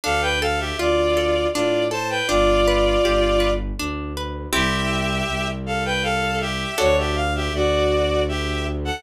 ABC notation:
X:1
M:3/4
L:1/16
Q:1/4=80
K:C
V:1 name="Violin"
[Af] [Bg] [Af] [Ge] [Fd]4 [Fd]2 [ca] [Bg] | [Fd]8 z4 | [Ge]6 [Af] [Bg] [Af]2 [Ge]2 | ^c [Ge] f [Ge] [^Fd]4 [Ge]2 z [A^f] |]
V:2 name="Orchestral Harp"
D2 A2 F2 A2 D2 A2 | D2 B2 G2 B2 D2 B2 | [CEG]12 | [D^FA]12 |]
V:3 name="Violin" clef=bass
D,,4 D,,4 A,,4 | G,,,4 G,,,4 D,,4 | C,,4 C,,8 | D,,4 D,,8 |]